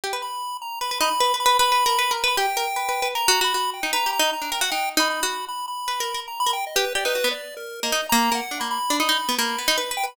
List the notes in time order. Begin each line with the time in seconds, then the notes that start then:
0.04 G4
0.13 B4
0.22 B5
0.62 A#5
0.81 B4 B5
0.91 B4
1.00 D#4 B5
1.20 B4
1.34 B4
1.40 B5
1.46 B4
1.59 B4 B5
1.72 B4
1.86 A#4
1.99 B4
2.11 A#4
2.17 B5
2.24 B4
2.28 B5
2.37 G4 G5
2.57 A#4
2.76 B4
2.89 B4
3.02 B4
3.15 A#4 A#5
3.28 F#4
3.41 F#4 B5
3.54 F#4
3.74 G5
3.83 D#4
3.93 B4 A#5
4.06 G4
4.13 A#5
4.19 D#4
4.33 A#5
4.42 D4
4.52 A#4 G5
4.61 F#4 F#5
4.72 D#4 G5
4.97 D#4 B5
5.10 B5
5.23 F#4
5.48 B5
5.68 B5
5.88 B4
6.00 A#4
6.14 A#4
6.28 A#5
6.40 B5
6.46 A#4
6.53 G5
6.67 D#5
6.76 G4 B4
6.95 G4 D5
7.05 D#4 B4
7.15 F#4
7.24 B3
7.31 D5
7.57 A#4
7.83 A#3 D#5
7.92 D#4
8.09 A#3 A#5
8.32 A#3 F#5
8.51 D4
8.60 A#3 B5
8.71 B5
8.90 D4
9.00 D#4 B5
9.09 D#4
9.29 B3
9.38 A#3 B5
9.58 B3
9.68 D#4
9.78 B4
9.91 B4
9.97 G5
10.03 B4 B5